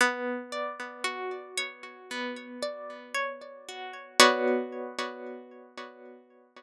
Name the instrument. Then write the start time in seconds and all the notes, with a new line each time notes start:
orchestral harp
0.01 B3
0.52 D5
1.04 F#4
1.57 C#5
2.11 B3
2.63 D5
3.14 C#5
3.69 F#4
4.20 B3 F#4 C#5 D5